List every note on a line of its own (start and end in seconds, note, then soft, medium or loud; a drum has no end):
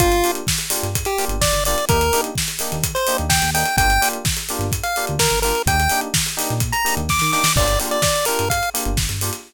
0.00 0.22 G1 medium
0.00 0.08 A#3 loud
0.00 0.08 D4 medium
0.00 0.08 F4 loud
0.00 0.31 F4 loud
0.00 0.08 G4 loud
0.00 kick medium
0.00 closed hi-hat medium
0.12 closed hi-hat medium
0.24 0.40 A#3 medium
0.24 0.40 D4 medium
0.24 0.40 F4 medium
0.24 0.40 G4 medium
0.24 open hi-hat medium
0.35 closed hi-hat medium
0.47 kick medium
0.47 snare loud
0.58 closed hi-hat medium
0.70 0.86 A#3 medium
0.70 0.86 D4 medium
0.70 0.86 F4 medium
0.70 0.86 G4 medium
0.70 open hi-hat medium
0.83 1.04 G1 medium
0.83 closed hi-hat medium
0.95 kick medium
0.95 closed hi-hat medium
1.05 1.25 G4 medium
1.05 closed hi-hat medium
1.18 1.35 A#3 medium
1.18 1.35 D4 medium
1.18 1.35 F4 medium
1.18 1.35 G4 medium
1.18 open hi-hat medium
1.28 1.50 G1 medium
1.28 closed hi-hat medium
1.41 1.64 D5 medium
1.41 kick medium
1.41 snare medium
1.53 1.74 G1 medium
1.53 closed hi-hat medium
1.65 1.75 A#3 medium
1.65 1.75 D4 medium
1.65 1.75 F4 medium
1.65 1.75 G4 medium
1.65 1.85 D5 medium
1.65 open hi-hat medium
1.78 closed hi-hat medium
1.89 2.10 D#2 medium
1.89 1.97 A#3 loud
1.89 1.97 D4 loud
1.89 1.97 D#4 loud
1.89 1.97 G4 loud
1.89 2.21 A#4 medium
1.89 kick medium
1.89 closed hi-hat medium
2.01 closed hi-hat medium
2.13 2.29 A#3 medium
2.13 2.29 D4 medium
2.13 2.29 D#4 medium
2.13 2.29 G4 medium
2.13 open hi-hat medium
2.24 closed hi-hat medium
2.35 kick medium
2.35 snare medium
2.48 closed hi-hat medium
2.59 2.76 A#3 loud
2.59 2.76 D4 medium
2.59 2.76 D#4 medium
2.59 2.76 G4 medium
2.59 open hi-hat medium
2.72 2.93 D#2 medium
2.72 closed hi-hat medium
2.83 kick medium
2.83 closed hi-hat loud
2.95 3.17 C5 medium
2.95 closed hi-hat medium
3.07 3.24 A#3 medium
3.07 3.24 D4 medium
3.07 3.24 D#4 medium
3.07 3.24 G4 medium
3.07 open hi-hat medium
3.18 3.41 D#2 medium
3.18 closed hi-hat medium
3.29 3.51 G5 medium
3.29 kick medium
3.29 snare loud
3.42 3.64 D#2 medium
3.42 closed hi-hat medium
3.54 3.62 A#3 medium
3.54 3.62 D4 medium
3.54 3.62 D#4 medium
3.54 3.62 G4 medium
3.54 3.76 G5 medium
3.54 open hi-hat medium
3.65 closed hi-hat medium
3.77 3.98 G1 medium
3.77 3.86 A#3 loud
3.77 3.86 D4 loud
3.77 3.86 F4 loud
3.77 3.86 G4 loud
3.77 4.09 G5 loud
3.77 kick medium
3.77 closed hi-hat medium
3.90 closed hi-hat medium
4.01 4.18 A#3 medium
4.01 4.18 D4 medium
4.01 4.18 F4 medium
4.01 4.18 G4 loud
4.01 open hi-hat medium
4.13 closed hi-hat medium
4.25 kick medium
4.25 snare medium
4.37 closed hi-hat medium
4.49 4.66 A#3 medium
4.49 4.66 D4 medium
4.49 4.66 F4 medium
4.49 4.66 G4 medium
4.49 open hi-hat medium
4.59 4.80 G1 medium
4.59 closed hi-hat medium
4.72 kick medium
4.72 closed hi-hat medium
4.83 5.06 F5 medium
4.83 closed hi-hat medium
4.96 5.13 A#3 medium
4.96 5.13 D4 medium
4.96 5.13 F4 medium
4.96 5.13 G4 medium
4.96 open hi-hat medium
5.07 5.30 D2 medium
5.07 closed hi-hat medium
5.19 5.40 A#4 medium
5.19 kick medium
5.19 snare loud
5.30 5.52 G1 medium
5.30 closed hi-hat medium
5.42 5.52 A#3 medium
5.42 5.52 D4 medium
5.42 5.52 F4 medium
5.42 5.52 G4 medium
5.42 5.62 A#4 medium
5.42 open hi-hat medium
5.55 closed hi-hat medium
5.66 5.87 D#2 medium
5.66 5.75 A#3 loud
5.66 5.75 D4 medium
5.66 5.75 D#4 loud
5.66 5.75 G4 medium
5.66 6.01 G5 medium
5.66 kick medium
5.66 closed hi-hat medium
5.80 closed hi-hat medium
5.89 6.07 A#3 medium
5.89 6.07 D4 loud
5.89 6.07 D#4 medium
5.89 6.07 G4 medium
5.89 open hi-hat medium
6.01 closed hi-hat medium
6.14 kick medium
6.14 snare loud
6.26 closed hi-hat medium
6.37 6.53 A#3 medium
6.37 6.53 D4 medium
6.37 6.53 D#4 loud
6.37 6.53 G4 loud
6.37 open hi-hat medium
6.50 6.72 A#2 medium
6.50 closed hi-hat medium
6.60 kick medium
6.60 closed hi-hat medium
6.72 6.95 A#5 medium
6.72 closed hi-hat medium
6.84 7.01 A#3 medium
6.84 7.01 D4 medium
6.84 7.01 D#4 medium
6.84 7.01 G4 medium
6.84 open hi-hat medium
6.97 7.18 D#2 medium
6.97 closed hi-hat medium
7.09 7.32 D6 medium
7.09 kick medium
7.09 snare medium
7.19 7.43 D#3 medium
7.19 snare medium
7.32 7.41 A#3 medium
7.32 7.41 D4 medium
7.32 7.41 D#4 medium
7.32 7.41 G4 medium
7.32 7.53 D6 medium
7.32 snare medium
7.44 snare loud
7.56 7.77 G1 medium
7.56 7.65 A#3 loud
7.56 7.65 D4 loud
7.56 7.65 F4 loud
7.56 7.65 G4 loud
7.56 7.79 D5 medium
7.56 kick medium
7.56 crash medium
7.68 closed hi-hat medium
7.80 7.96 A#3 medium
7.80 7.96 D4 medium
7.80 7.96 F4 loud
7.80 7.96 G4 medium
7.80 open hi-hat medium
7.91 8.02 D5 medium
7.91 closed hi-hat medium
8.02 8.25 D5 medium
8.02 kick medium
8.02 snare medium
8.16 closed hi-hat medium
8.25 8.44 A#3 medium
8.25 8.44 D4 medium
8.25 8.44 F4 medium
8.25 8.44 G4 medium
8.25 8.49 A#4 medium
8.25 open hi-hat medium
8.39 8.61 G1 medium
8.39 closed hi-hat medium
8.50 8.70 F5 medium
8.50 kick medium
8.50 closed hi-hat medium
8.63 closed hi-hat medium
8.74 8.90 A#3 medium
8.74 8.90 D4 medium
8.74 8.90 F4 medium
8.74 8.90 G4 medium
8.74 open hi-hat medium
8.85 9.07 G1 medium
8.85 closed hi-hat medium
8.97 kick medium
8.97 snare medium
9.09 9.31 G1 medium
9.09 closed hi-hat medium
9.21 9.30 A#3 medium
9.21 9.30 D4 medium
9.21 9.30 F4 medium
9.21 9.30 G4 medium
9.21 open hi-hat medium
9.33 closed hi-hat medium